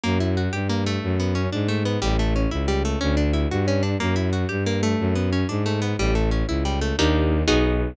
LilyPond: <<
  \new Staff \with { instrumentName = "Acoustic Guitar (steel)" } { \time 6/8 \key d \lydian \tempo 4. = 121 ais8 e'8 fis'8 g'8 ais8 a8~ | a8 b8 cis'8 d'8 a8 b8 | g8 a8 cis'8 e'8 g8 a8 | cis'8 d'8 e'8 fis'8 cis'8 d'8 |
ais8 e'8 fis'8 g'8 ais8 a8~ | a8 b8 cis'8 d'8 a8 b8 | g8 a8 cis'8 e'8 g8 a8 | \key ees \lydian <bes d' ees' g'>4. <ces' ees' ges' aes'>4. | }
  \new Staff \with { instrumentName = "Violin" } { \clef bass \time 6/8 \key d \lydian fis,4. g,4. | fis,4. gis,4. | a,,4. cis,4. | d,4. g,4. |
fis,4. g,4. | fis,4. gis,4. | a,,4. cis,4. | \key ees \lydian ees,4. ces,4. | }
>>